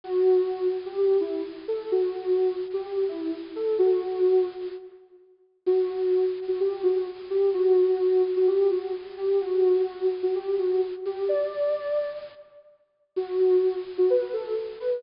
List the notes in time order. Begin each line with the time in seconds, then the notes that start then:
0.04 F#4
0.85 G4
0.97 G4
1.20 E4
1.68 A4
1.92 F#4
2.73 G4
2.85 G4
3.08 E4
3.55 A4
3.79 F#4
5.66 F#4
6.48 F#4
6.60 G4
6.83 F#4
7.30 G4
7.53 F#4
8.36 F#4
8.47 G4
8.71 F#4
9.17 G4
9.41 F#4
10.23 F#4
10.35 G4
10.58 F#4
11.05 G4
11.29 D5
13.16 F#4
13.98 F#4
14.10 B4
14.33 A4
14.80 B4